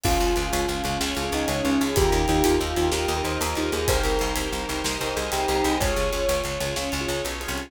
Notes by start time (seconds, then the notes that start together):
0.03 C#2 C#4 F4 G#4, kick, crash
0.20 C#2, ride
0.36 C#2 C#4 F4 G#4, ride
0.53 C#2, ride
0.68 C#2, ride
0.84 C#2 C#4 F4 G#4, ride
1.00 C#2 C#4 F4 G#4 C#5, snare
1.15 C#2 C#4 F4 G#4, ride
1.25 C#4 F4 G#4
1.32 C#2 D#4, ride
1.48 C#2 C#4, ride
1.64 C#2 C#4 F4 G#4, ride
1.81 C#2 G#4, ride
1.96 D#2 D#4 F4 G4 A#4, kick, ride
2.12 D#2, ride
2.28 D#2 D#4 F4 G4 A#4, ride
2.44 D#2 F4, ride
2.61 D#2, ride
2.76 D#2 D#4 F4 G4 A#4, ride
2.92 D#2 D#4 F4 G4 A#4 D#5, snare
3.08 D#2 D#4 F4 G4 A#4, ride
3.17 D#4 F4 G4 A#4
3.24 D#2 C5, ride
3.41 D#2 A#4, ride
3.55 D#2 D#4 F4 G4 A#4, ride
3.72 D#2 G#4, ride
3.88 C2 D#4 G4 A#4 C5, kick, ride
4.03 C2, ride
4.19 C2 D#4 G4 A#4 C5, ride
4.36 C2, ride
4.52 C2, ride
4.68 C2 D#4 G4 A#4 C5, ride
4.84 C2 D#4 G4 A#4 C5 D#5, snare
5.01 C2 D#4 G4 A#4 C5, ride
5.09 D#4 G4 A#4 C5
5.16 C2 G#4, ride
5.32 C2 G4, ride
5.48 C2 D#4 G4 A#4 C5, ride
5.64 C2 G#4, ride
5.80 C#2 F4 G#4 C#5, kick, ride
5.96 C#2, ride
6.12 C#2 F4 G#4 C#5, ride
6.29 C#2, ride
6.44 C#2, ride
6.60 C#2 F4 G#4 C#5, ride
6.76 C#2 C#4 F4 G#4 C#5, snare
6.92 C#2 F4 G#4 C#5, ride
7.00 F4 G#4 C#5
7.08 C#2, ride
7.25 B1, ride
7.41 F4 G#4 C#5, ride
7.48 C2
7.57 ride